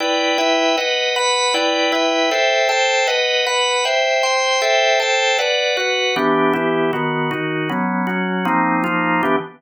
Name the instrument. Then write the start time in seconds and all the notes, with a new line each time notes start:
drawbar organ
0.00 E4 B4 D5 G5
0.38 E4 B4 E5 G5
0.78 B4 D#5 F#5
1.16 B4 F#5 B5
1.54 E4 B4 D5 G5
1.92 E4 B4 E5 G5
2.31 A4 C5 E5 G5
2.69 A4 C5 G5 A5
3.07 B4 D#5 F#5
3.46 B4 F#5 B5
3.85 C5 E5 G5
4.23 C5 G5 C6
4.62 A4 C5 E5 G5
5.00 A4 C5 G5 A5
5.39 B4 D5 F#5
5.77 F#4 B4 F#5
6.16 E3 B3 D4 G4
6.53 E3 B3 E4 G4
6.93 D#3 B3 F#4
7.31 D#3 D#4 F#4
7.69 F#3 B3 C#4
8.07 F#3 C#4 F#4
8.45 F3 A#3 C4 D#4
8.84 F3 A#3 D#4 F4
9.23 E3 B3 D4 G4